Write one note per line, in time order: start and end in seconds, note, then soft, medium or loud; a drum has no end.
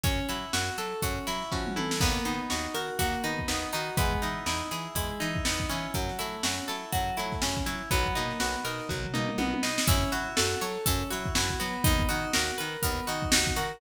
0.03 0.20 F#2 medium
0.03 0.26 C#4 medium
0.03 1.51 C#4 loud
0.03 kick loud
0.03 closed hi-hat medium
0.28 0.45 F#3 medium
0.28 1.26 E4 medium
0.28 0.52 E4 medium
0.28 closed hi-hat medium
0.53 0.70 F#2 loud
0.53 0.76 F#4 medium
0.53 1.02 F#4 loud
0.53 snare medium
0.78 0.94 F#3 medium
0.78 1.00 A4 medium
0.78 1.96 A4 medium
0.78 closed hi-hat medium
1.02 1.19 F#2 medium
1.02 1.25 C#4 medium
1.02 1.97 F#4 medium
1.02 kick medium
1.02 closed hi-hat medium
1.27 1.44 F#3 medium
1.27 1.76 E4 medium
1.27 1.50 E4 medium
1.27 closed hi-hat medium
1.42 snare soft
1.52 1.75 F3 medium
1.52 1.99 C#4 medium
1.52 1.74 F#4 medium
1.52 kick medium
1.66 mid tom medium
1.76 2.00 E3 medium
1.76 2.00 E4 medium
1.76 1.99 A4 medium
1.76 high tom medium
1.91 snare medium
2.00 2.18 D#2 loud
2.00 2.23 A#3 medium
2.00 3.48 B3 loud
2.00 kick loud
2.00 crash medium
2.25 2.41 D#3 medium
2.25 2.48 B3 medium
2.25 3.23 D#4 medium
2.25 snare soft
2.25 closed hi-hat medium
2.50 2.68 D#2 medium
2.50 2.73 D#4 medium
2.50 2.98 F#4 medium
2.50 snare medium
2.74 2.90 D#3 medium
2.74 2.97 F#4 medium
2.74 3.93 A#4 medium
2.74 closed hi-hat medium
2.99 3.15 D#2 medium
2.99 3.22 A#3 medium
2.99 3.93 F#4 loud
2.99 kick medium
2.99 closed hi-hat medium
3.14 snare soft
3.24 3.40 D#3 medium
3.24 3.46 B3 medium
3.24 3.72 D#4 medium
3.24 closed hi-hat medium
3.39 kick medium
3.48 3.65 D#2 medium
3.48 3.95 B3 medium
3.48 3.71 D#4 medium
3.48 snare medium
3.73 3.90 D#3 medium
3.73 3.97 D#4 loud
3.73 3.96 F#4 medium
3.73 snare soft
3.73 closed hi-hat medium
3.97 4.13 E2 loud
3.97 4.20 G#3 medium
3.97 5.44 B3 loud
3.97 kick loud
3.97 closed hi-hat medium
4.12 kick medium
4.22 4.39 E3 medium
4.22 5.20 D#4 medium
4.22 4.45 E4 medium
4.22 closed hi-hat medium
4.46 4.62 E2 medium
4.46 4.69 D#4 medium
4.46 4.95 E4 medium
4.46 snare medium
4.71 4.88 E3 medium
4.71 4.94 E4 medium
4.71 5.89 G#4 medium
4.71 closed hi-hat medium
4.95 5.11 E2 medium
4.95 5.18 G#3 medium
4.95 5.90 E4 medium
4.95 kick medium
4.95 closed hi-hat medium
5.20 5.37 E3 medium
5.20 5.91 D#4 medium
5.20 5.43 E4 medium
5.20 closed hi-hat medium
5.35 kick medium
5.45 5.62 E2 medium
5.45 5.92 B3 medium
5.45 5.68 D#4 medium
5.45 snare loud
5.60 kick medium
5.69 5.87 E3 medium
5.69 7.41 C#4 loud
5.69 5.92 E4 medium
5.69 closed hi-hat medium
5.94 6.11 F#2 medium
5.94 6.17 F#3 medium
5.94 kick medium
5.94 closed hi-hat medium
6.09 snare soft
6.19 6.37 F#3 medium
6.19 6.41 A3 medium
6.19 7.17 E4 medium
6.19 snare soft
6.19 closed hi-hat medium
6.43 6.60 F#2 medium
6.43 6.66 C#4 medium
6.43 6.92 F#4 medium
6.43 snare loud
6.68 6.85 F#3 medium
6.68 6.91 E4 medium
6.68 7.86 A4 medium
6.68 closed hi-hat medium
6.92 7.11 F#2 medium
6.92 7.15 F#3 medium
6.92 7.87 F#4 medium
6.92 kick medium
6.92 closed hi-hat medium
7.17 7.35 F#3 medium
7.17 7.40 A3 medium
7.17 7.66 E4 medium
7.17 closed hi-hat medium
7.32 kick medium
7.32 snare soft
7.42 7.59 F#2 medium
7.42 7.89 C#4 medium
7.42 7.65 C#4 medium
7.42 snare medium
7.57 kick medium
7.57 snare soft
7.66 7.82 F#3 medium
7.66 7.89 E4 medium
7.66 7.90 E4 medium
7.66 closed hi-hat medium
7.91 8.07 B1 loud
7.91 8.14 F#3 medium
7.91 9.38 B3 loud
7.91 kick medium
7.91 closed hi-hat medium
8.06 kick medium
8.15 8.33 B2 medium
8.15 8.38 A#3 medium
8.15 9.13 D#4 medium
8.15 closed hi-hat medium
8.31 snare soft
8.40 8.56 B1 medium
8.40 8.63 B3 medium
8.40 8.89 F#4 medium
8.40 snare medium
8.55 snare soft
8.65 8.81 B2 medium
8.65 8.87 D#4 medium
8.65 9.83 A#4 medium
8.65 closed hi-hat medium
8.80 snare soft
8.89 9.06 B1 medium
8.89 9.11 F#3 medium
8.89 9.84 F#4 medium
8.89 kick medium
8.89 floor tom medium
9.04 floor tom medium
9.13 9.31 B2 medium
9.13 9.36 A#3 medium
9.13 9.62 D#4 medium
9.13 mid tom medium
9.29 mid tom medium
9.38 9.54 B1 medium
9.38 9.61 B3 medium
9.38 9.86 B3 medium
9.38 high tom medium
9.53 high tom medium
9.62 9.79 B2 medium
9.62 9.85 D#4 medium
9.62 9.86 D#4 medium
9.62 snare medium
9.78 snare loud
9.87 10.04 F#2 loud
9.87 10.10 C#4 loud
9.87 10.12 E4 loud
9.87 kick loud
9.87 closed hi-hat loud
10.12 10.28 F#3 loud
10.12 10.35 E4 medium
10.12 10.37 F#4 medium
10.12 closed hi-hat medium
10.37 10.55 F#2 loud
10.37 10.59 F#4 medium
10.37 10.61 A4 loud
10.37 snare loud
10.61 10.78 F#3 loud
10.61 10.84 A4 medium
10.61 10.86 C#5 loud
10.61 closed hi-hat medium
10.86 11.03 F#2 loud
10.86 11.09 C#4 medium
10.86 11.10 A4 loud
10.86 kick medium
10.86 closed hi-hat loud
11.10 11.29 F#3 medium
11.10 11.33 E4 medium
11.10 11.35 F#4 medium
11.10 closed hi-hat medium
11.26 kick medium
11.35 11.51 F#2 loud
11.35 11.60 E4 loud
11.35 11.58 F#4 medium
11.35 snare loud
11.50 kick medium
11.59 11.77 F#3 loud
11.59 12.07 B3 medium
11.59 11.83 F#4 loud
11.59 closed hi-hat medium
11.84 12.03 D#2 loud
11.84 12.09 D#4 loud
11.84 kick loud
11.84 closed hi-hat loud
11.99 kick medium
12.08 12.26 D#3 loud
12.08 12.31 D#4 medium
12.08 12.33 F#4 medium
12.08 closed hi-hat medium
12.33 12.51 D#2 loud
12.33 12.56 F#4 medium
12.33 12.58 A#4 loud
12.33 snare loud
12.49 snare soft
12.58 12.77 D#3 medium
12.58 12.81 A#4 medium
12.58 12.82 B4 loud
12.58 closed hi-hat medium
12.82 13.00 D#2 medium
12.82 13.05 B3 medium
12.82 13.07 A#4 loud
12.82 kick medium
12.82 closed hi-hat loud
13.07 13.25 D#3 medium
13.07 13.30 D#4 medium
13.07 13.32 F#4 medium
13.07 closed hi-hat medium
13.22 kick medium
13.32 13.49 D#2 loud
13.32 13.56 D#4 loud
13.32 13.54 F#4 medium
13.32 snare loud
13.47 kick medium
13.56 13.72 D#3 medium
13.56 13.80 F#4 loud
13.56 13.79 A#4 medium
13.56 closed hi-hat medium